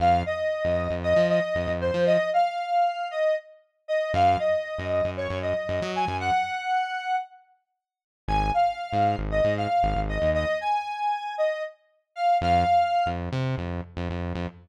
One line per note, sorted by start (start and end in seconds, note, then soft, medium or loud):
0.00 0.23 F2 medium
0.00 0.22 F5 medium
0.26 0.93 D#5 medium
0.65 0.88 F2 medium
0.90 1.14 F2 medium
1.03 1.27 D#5 medium
1.16 1.40 F3 medium
1.29 1.72 D#5 medium
1.55 1.67 F2 medium
1.68 1.91 F2 medium
1.81 2.05 C5 medium
1.94 2.17 F3 medium
2.06 2.30 D#5 medium
2.33 3.08 F5 medium
3.11 3.35 D#5 medium
3.88 4.12 D#5 medium
4.14 4.37 F#2 loud
4.14 4.38 F5 medium
4.39 5.10 D#5 medium
4.78 5.02 F#2 medium
5.04 5.28 F#2 medium
5.17 5.39 C#5 medium
5.30 5.54 F#2 medium
5.42 5.90 D#5 medium
5.69 5.81 F#2 medium
5.82 6.05 F#3 medium
5.96 6.17 G#5 medium
6.08 6.31 F#2 medium
6.20 7.16 F#5 medium
8.28 8.51 G#1 medium
8.28 8.51 G#5 medium
8.54 9.17 F5 medium
8.93 9.16 G#2 medium
9.18 9.41 G#1 medium
9.31 9.54 D#5 medium
9.44 9.67 G#2 medium
9.57 10.00 F5 medium
9.83 9.94 G#1 medium
9.96 10.19 G#1 medium
10.09 10.30 D#5 medium
10.22 10.45 D#2 medium
10.34 10.58 D#5 medium
10.61 11.35 G#5 medium
11.38 11.63 D#5 medium
12.16 12.37 F5 medium
12.41 12.64 F2 loud
12.41 13.08 F5 medium
13.06 13.29 F2 medium
13.32 13.56 C3 medium
13.58 13.81 F2 medium
13.97 14.08 F2 medium
14.10 14.33 F2 medium
14.35 14.47 F2 medium